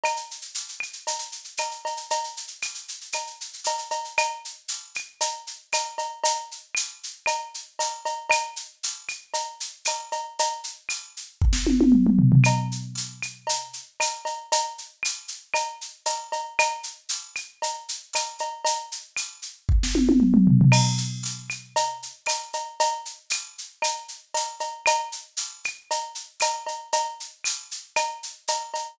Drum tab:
CC |----------------|----------------|----------------|----------------|
TB |----x-------x---|----x-------x---|----x-------x---|----x-------x---|
SH |xxxxxxxxxxxxxxxx|xxxxxxxxxxxxxxxx|x-x-x-x-x-x-x-x-|x-x-x-x-x-x-x-x-|
CB |x-------x---x-x-|x-------x---x-x-|x-------x---x-x-|x-------x---x-x-|
CL |x-----x-----x---|----x---x-------|x-----x-----x---|----x---x-------|
SD |----------------|----------------|----------------|----------------|
T1 |----------------|----------------|----------------|----------------|
T2 |----------------|----------------|----------------|----------------|
FT |----------------|----------------|----------------|----------------|
BD |----------------|----------------|----------------|----------------|

CC |----------------|----------------|----------------|----------------|
TB |----x-------x---|----x-----------|----x-------x---|----x-------x---|
SH |x-x-x-x-x-x-x-x-|x-x-x-x---------|x-x-x-x-x-x-x-x-|x-x-x-x-x-x-x-x-|
CB |x-------x---x-x-|x---------------|x-------x---x-x-|x-------x---x-x-|
CL |x-----x-----x---|----x-----------|x-----x-----x---|----x---x-------|
SD |----------------|---------o------|----------------|----------------|
T1 |----------------|----------oo----|----------------|----------------|
T2 |----------------|------------oo--|----------------|----------------|
FT |----------------|--------------oo|----------------|----------------|
BD |----------------|--------o-------|----------------|----------------|

CC |----------------|----------------|x---------------|----------------|
TB |----x-------x---|----x-----------|----x-------x---|----x-------x---|
SH |x-x-x-x-x-x-x-x-|x-x-x-x---------|--x-x-x-x-x-x-x-|x-x-x-x-x-x-x-x-|
CB |x-------x---x-x-|x---------------|x-------x---x-x-|x-------x---x-x-|
CL |x-----x-----x---|----x-----------|x-----x-----x---|----x---x-------|
SD |----------------|---------o------|----------------|----------------|
T1 |----------------|----------oo----|----------------|----------------|
T2 |----------------|------------oo--|----------------|----------------|
FT |----------------|--------------oo|----------------|----------------|
BD |----------------|--------o-------|----------------|----------------|

CC |----------------|----------------|
TB |----x-------x---|----x-------x---|
SH |x-x-x-x-x-x-x-x-|x-x-x-x-x-x-x-x-|
CB |x-------x---x-x-|x-------x---x-x-|
CL |x-----x-----x---|----x---x-------|
SD |----------------|----------------|
T1 |----------------|----------------|
T2 |----------------|----------------|
FT |----------------|----------------|
BD |----------------|----------------|